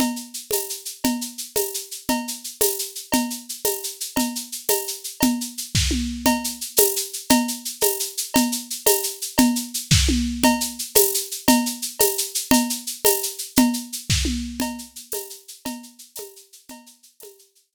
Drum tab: TB |---x--|---x--|---x--|---x--|
SH |xxxxxx|xxxxxx|xxxxxx|xxxxxx|
CB |x--x--|x--x--|x--x--|x--x--|
SD |------|------|------|------|
T1 |------|------|------|------|
CG |O--o--|O--o--|O--o--|O--o--|
BD |------|------|------|------|

TB |---x--|------|---x--|---x--|
SH |xxxxxx|xxx---|xxxxxx|xxxxxx|
CB |x--x--|x-----|x--x--|x--x--|
SD |------|---o--|------|------|
T1 |------|----o-|------|------|
CG |O--o--|O-----|O--o--|O--o--|
BD |------|---o--|------|------|

TB |---x--|------|---x--|---x--|
SH |xxxxxx|xxx---|xxxxxx|xxxxxx|
CB |x--x--|x-----|x--x--|x--x--|
SD |------|---o--|------|------|
T1 |------|----o-|------|------|
CG |O--o--|O-----|O--o--|O--o--|
BD |------|---o--|------|------|

TB |---x--|------|---x--|---x--|
SH |xxxxxx|xxx---|xxxxxx|xxxxxx|
CB |x--x--|x-----|x--x--|x--x--|
SD |------|---o--|------|------|
T1 |------|----o-|------|------|
CG |O--o--|O-----|O--o--|O--o--|
BD |------|---o--|------|------|

TB |---x--|------|
SH |xxxxxx|x-----|
CB |x--x--|------|
SD |------|------|
T1 |------|------|
CG |O--o--|O-----|
BD |------|------|